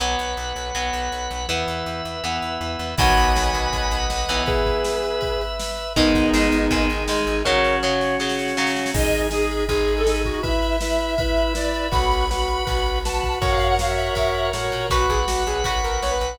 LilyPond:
<<
  \new Staff \with { instrumentName = "Distortion Guitar" } { \time 4/4 \key b \major \tempo 4 = 161 r1 | r1 | <gis'' b''>2. r4 | <gis' b'>2. r4 |
<b dis'>2. r4 | <ais' cis''>4 cis''4 r2 | r1 | r1 |
r1 | r1 | fis'16 fis'16 gis'16 r16 fis'8 gis'8 r8 ais'8 cis''16 b'8. | }
  \new Staff \with { instrumentName = "Lead 1 (square)" } { \time 4/4 \key b \major r1 | r1 | r1 | r1 |
r1 | r1 | dis''8. r16 gis'4 gis'8. a'8. fis'8 | e''2. d''4 |
b''2. a''4 | fis''16 eis''8 fis''16 f''16 e''4.~ e''16 r4 | r1 | }
  \new Staff \with { instrumentName = "Overdriven Guitar" } { \time 4/4 \key b \major <fis b>2 <fis b>2 | <e b>2 <e b>2 | <dis fis b>2.~ <dis fis b>8 <e b>8~ | <e b>1 |
<dis gis>4 <dis gis>4 <dis gis>4 <dis gis>4 | <cis fis>4 <cis fis>4 <cis fis>4 <cis fis>4 | r1 | r1 |
r1 | r1 | <fis' b'>2 <fis' b'>2 | }
  \new Staff \with { instrumentName = "Drawbar Organ" } { \time 4/4 \key b \major <b' fis''>1 | <b' e''>1 | <b' dis'' fis''>1 | <b' e''>1 |
<dis' gis'>1 | <cis' fis'>1 | <dis' gis'>4 <dis' gis'>4 <dis' gis'>4 <dis' gis'>4 | <e' b'>4 <e' b'>4 <e' b'>4 <e' b'>4 |
<fis' b'>4 <fis' b'>4 <fis' b'>4 <fis' b'>4 | <fis' ais' cis''>4 <fis' ais' cis''>4 <fis' ais' cis''>4 <fis' ais' cis''>4 | <b' fis''>1 | }
  \new Staff \with { instrumentName = "Electric Bass (finger)" } { \clef bass \time 4/4 \key b \major b,,8 b,,8 b,,8 b,,8 b,,8 b,,8 b,,8 b,,8 | e,8 e,8 e,8 e,8 e,8 e,8 e,8 e,8 | b,,8 b,,8 b,,8 b,,8 b,,8 b,,8 b,,8 b,,8 | r1 |
gis,,8 gis,,8 gis,,8 gis,,8 gis,,8 gis,,8 gis,,8 gis,,8 | r1 | gis,,2 gis,,2 | r1 |
b,,2 b,,2 | fis,2 fis,4 a,8 ais,8 | b,,8 b,,8 b,,8 b,,8 b,,8 b,,8 b,,8 b,,8 | }
  \new DrumStaff \with { instrumentName = "Drums" } \drummode { \time 4/4 r4 r4 r4 r4 | r4 r4 r4 r4 | <cymc bd>8 cymr8 sn8 cymr8 <bd cymr>8 cymr8 sn8 cymr8 | <bd cymr>8 <bd cymr>8 sn8 cymr8 <bd cymr>8 cymr8 sn8 cymr8 |
<bd cymr>8 <bd cymr>8 sn8 cymr8 <bd cymr>8 cymr8 sn8 cymr8 | <bd sn>8 sn8 sn8 sn8 sn16 sn16 sn16 sn16 sn16 sn16 sn16 sn16 | <cymc bd>16 cymr16 cymr16 cymr16 sn16 cymr16 cymr16 cymr16 <bd cymr>16 cymr16 cymr16 cymr16 sn16 cymr16 <bd cymr>16 cymr16 | <bd cymr>16 cymr16 cymr16 cymr16 sn16 cymr16 cymr16 cymr16 <bd cymr>16 cymr16 cymr16 cymr16 sn16 cymr16 cymr16 cymr16 |
<bd cymr>16 cymr16 cymr16 cymr16 sn16 cymr16 cymr16 cymr16 <bd cymr>16 cymr16 cymr16 cymr16 sn16 cymr16 <bd cymr>16 cymr16 | <bd cymr>16 cymr16 cymr16 cymr16 sn16 cymr16 cymr16 cymr16 <bd cymr>16 cymr16 cymr16 cymr16 sn16 cymr16 cymr16 cymr16 | <bd cymr>8 <bd cymr>8 sn8 cymr8 <bd cymr>8 cymr8 sn8 cymr8 | }
>>